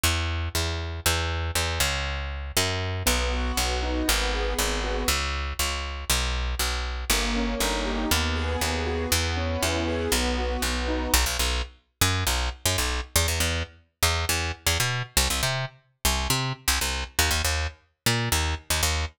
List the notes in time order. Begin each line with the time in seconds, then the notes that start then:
0.03 E2
0.55 E2
1.06 E2
1.55 E2
1.80 C#2
2.57 F#2
3.06 B1 B3
3.33 F#4
3.57 B1 B3
3.82 D#4
4.08 G#1 B3
4.34 G#4
4.59 G#1 B3
4.84 F#4
5.08 C#2
5.59 C#2
6.10 B1
6.59 B1
7.10 G1 A#3
7.36 C#4
7.60 G1 D#4
7.85 G4
8.11 D#2 B3
8.36 G#4
8.61 D#2 B3
8.86 F#4
9.12 E2 B3
9.37 C#4
9.62 E2 E4
9.88 G#4
10.12 B1 B3
10.38 F#4
10.62 B1 B3
10.88 D#4
11.14 B1
11.26 B1
11.39 B1
12.01 F#2
12.27 B1
12.65 F#2
12.78 B1
13.16 E2
13.28 E2
13.40 E2
14.03 E2
14.29 E2
14.66 E2
14.80 B2
15.17 C2
15.30 C2
15.43 C3
16.05 C2
16.30 C3
16.68 C2
16.81 C2
17.19 D#2
17.31 D#2
17.44 D#2
18.06 A#2
18.32 D#2
18.70 D#2
18.83 D#2